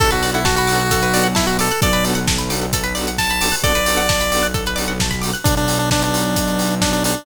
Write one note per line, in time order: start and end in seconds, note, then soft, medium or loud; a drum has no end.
0.00 1.67 B1 loud
0.00 0.08 B3 loud
0.00 0.08 D4 loud
0.00 0.08 F#4 loud
0.00 0.08 A4 loud
0.00 0.10 A4 medium
0.00 0.11 A4 medium
0.00 kick loud
0.00 crash medium
0.11 0.31 F#4 medium
0.11 0.21 B4 medium
0.11 closed hi-hat medium
0.23 0.40 B3 medium
0.23 0.40 D4 medium
0.23 0.40 F#4 medium
0.23 0.40 A4 medium
0.23 0.33 D5 medium
0.23 open hi-hat medium
0.34 0.45 E4 medium
0.34 0.45 F#5 medium
0.34 closed hi-hat medium
0.45 0.56 F#4 medium
0.45 0.55 A5 medium
0.45 kick medium
0.45 snare loud
0.56 1.28 F#4 medium
0.56 0.68 B5 medium
0.56 closed hi-hat medium
0.67 0.83 B3 loud
0.67 0.83 D4 medium
0.67 0.83 F#4 loud
0.67 0.83 A4 medium
0.67 0.78 D6 medium
0.67 open hi-hat medium
0.79 0.89 F#6 medium
0.79 closed hi-hat medium
0.91 1.01 A4 medium
0.91 kick medium
0.91 closed hi-hat loud
1.02 1.13 B4 medium
1.02 closed hi-hat medium
1.12 1.28 B3 loud
1.12 1.28 D4 medium
1.12 1.28 F#4 medium
1.12 1.28 A4 medium
1.12 1.24 D5 medium
1.12 open hi-hat medium
1.24 1.34 F#5 medium
1.24 closed hi-hat medium
1.35 1.47 E4 medium
1.35 1.45 A5 medium
1.35 kick medium
1.35 snare loud
1.47 1.57 F#4 medium
1.47 1.58 B5 medium
1.47 closed hi-hat medium
1.58 1.66 B3 medium
1.58 1.66 D4 loud
1.58 1.66 F#4 loud
1.58 1.66 A4 medium
1.58 1.81 A4 medium
1.58 1.69 D6 medium
1.58 open hi-hat medium
1.70 1.82 F#6 medium
1.70 closed hi-hat medium
1.81 3.49 B1 medium
1.81 1.89 B3 loud
1.81 1.89 D4 loud
1.81 1.89 F#4 loud
1.81 1.89 A4 loud
1.81 1.92 A4 medium
1.81 2.05 D5 medium
1.81 kick loud
1.81 closed hi-hat medium
1.93 2.03 B4 medium
1.93 closed hi-hat medium
2.04 2.20 B3 medium
2.04 2.20 D4 medium
2.04 2.20 F#4 medium
2.04 2.20 A4 loud
2.04 2.15 D5 medium
2.04 open hi-hat medium
2.15 2.25 F#5 medium
2.15 closed hi-hat medium
2.27 2.38 A5 medium
2.27 kick medium
2.27 snare loud
2.39 2.49 B5 medium
2.39 closed hi-hat medium
2.50 2.66 B3 medium
2.50 2.66 D4 medium
2.50 2.66 F#4 medium
2.50 2.66 A4 loud
2.50 2.60 D6 medium
2.50 open hi-hat medium
2.61 2.72 F#6 medium
2.61 closed hi-hat medium
2.73 2.84 A4 medium
2.73 kick medium
2.73 closed hi-hat loud
2.84 2.94 B4 medium
2.84 closed hi-hat medium
2.95 3.11 B3 loud
2.95 3.11 D4 loud
2.95 3.11 F#4 medium
2.95 3.11 A4 medium
2.95 3.05 D5 medium
2.95 open hi-hat medium
3.07 3.18 F#5 medium
3.07 closed hi-hat medium
3.18 3.56 A5 medium
3.18 3.29 A5 medium
3.18 kick medium
3.18 snare medium
3.30 3.41 B5 medium
3.30 closed hi-hat medium
3.41 3.49 B3 medium
3.41 3.49 D4 loud
3.41 3.49 F#4 medium
3.41 3.49 A4 loud
3.41 3.52 D6 medium
3.41 open hi-hat medium
3.52 3.62 F#6 medium
3.52 open hi-hat medium
3.63 5.30 B1 loud
3.63 3.72 B3 loud
3.63 3.72 D4 loud
3.63 3.72 F#4 loud
3.63 3.74 A4 medium
3.63 3.72 A4 loud
3.63 4.48 D5 medium
3.63 kick medium
3.63 closed hi-hat medium
3.75 3.85 B4 medium
3.75 closed hi-hat medium
3.86 4.02 B3 medium
3.86 4.02 D4 loud
3.86 4.02 F#4 loud
3.86 4.02 A4 medium
3.86 3.97 D5 medium
3.86 open hi-hat medium
3.97 4.07 F#5 medium
4.09 4.19 A5 medium
4.09 kick medium
4.09 snare loud
4.09 closed hi-hat medium
4.20 4.31 B5 medium
4.20 closed hi-hat medium
4.31 4.47 B3 medium
4.31 4.47 D4 medium
4.31 4.47 F#4 loud
4.31 4.47 A4 medium
4.31 4.42 D6 medium
4.31 open hi-hat medium
4.43 4.53 F#6 medium
4.43 closed hi-hat medium
4.54 4.64 A4 medium
4.54 kick medium
4.54 closed hi-hat medium
4.66 4.77 B4 medium
4.66 closed hi-hat medium
4.76 4.93 B3 loud
4.76 4.93 D4 medium
4.76 4.93 F#4 medium
4.76 4.93 A4 medium
4.76 4.86 D5 medium
4.76 open hi-hat medium
4.88 4.98 F#5 medium
4.88 closed hi-hat medium
5.00 5.12 A5 medium
5.00 kick medium
5.00 snare loud
5.11 5.21 B5 medium
5.11 kick medium
5.11 closed hi-hat medium
5.22 5.30 B3 medium
5.22 5.30 D4 loud
5.22 5.30 F#4 loud
5.22 5.30 A4 loud
5.22 5.32 D6 medium
5.22 open hi-hat medium
5.34 5.44 F#6 medium
5.34 closed hi-hat medium
5.44 7.13 B1 medium
5.44 5.55 D4 medium
5.44 kick loud
5.44 closed hi-hat loud
5.57 5.78 D4 medium
5.57 closed hi-hat medium
5.68 open hi-hat medium
5.79 5.90 D4 medium
5.79 closed hi-hat medium
5.91 6.03 D4 medium
5.91 kick medium
5.91 snare loud
6.02 6.75 D4 medium
6.02 closed hi-hat medium
6.14 open hi-hat medium
6.25 closed hi-hat medium
6.36 kick medium
6.36 closed hi-hat loud
6.48 closed hi-hat medium
6.59 open hi-hat medium
6.70 closed hi-hat medium
6.82 6.92 D4 medium
6.82 kick medium
6.82 snare loud
6.93 7.04 D4 medium
6.93 closed hi-hat medium
7.04 7.25 D4 medium
7.04 open hi-hat medium
7.16 closed hi-hat medium